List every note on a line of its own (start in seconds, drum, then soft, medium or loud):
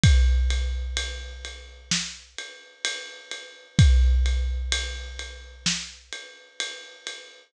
0.04 kick loud
0.04 ride loud
0.50 ride medium
0.97 ride medium
1.45 ride medium
1.91 snare loud
2.38 ride medium
2.85 ride loud
3.31 ride medium
3.79 kick loud
3.79 ride medium
4.26 ride medium
4.72 ride loud
5.19 ride medium
5.66 snare loud
6.12 ride medium
6.60 ride medium
7.07 ride medium